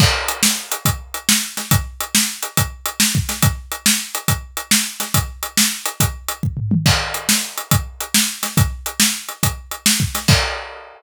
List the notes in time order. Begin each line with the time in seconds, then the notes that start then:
0.00 kick, crash
0.28 closed hi-hat
0.43 snare
0.72 closed hi-hat
0.85 kick, closed hi-hat
1.14 closed hi-hat
1.29 snare
1.57 snare, closed hi-hat
1.71 kick, closed hi-hat
2.01 closed hi-hat
2.15 snare
2.43 closed hi-hat
2.57 kick, closed hi-hat
2.86 closed hi-hat
3.00 snare
3.15 kick
3.29 snare, closed hi-hat
3.42 kick, closed hi-hat
3.72 closed hi-hat
3.86 snare
4.15 closed hi-hat
4.28 kick, closed hi-hat
4.57 closed hi-hat
4.71 snare
5.00 snare, closed hi-hat
5.14 kick, closed hi-hat
5.43 closed hi-hat
5.57 snare
5.86 closed hi-hat
6.00 kick, closed hi-hat
6.28 closed hi-hat
6.43 kick
6.57 floor tom
6.71 mid tom
6.86 kick, crash
7.14 closed hi-hat
7.29 snare
7.58 closed hi-hat
7.71 kick, closed hi-hat
8.01 closed hi-hat
8.14 snare
8.43 snare, closed hi-hat
8.57 kick, closed hi-hat
8.86 closed hi-hat
9.00 snare
9.29 closed hi-hat
9.43 kick, closed hi-hat
9.71 closed hi-hat
9.86 snare
10.00 kick
10.15 snare, closed hi-hat
10.28 kick, crash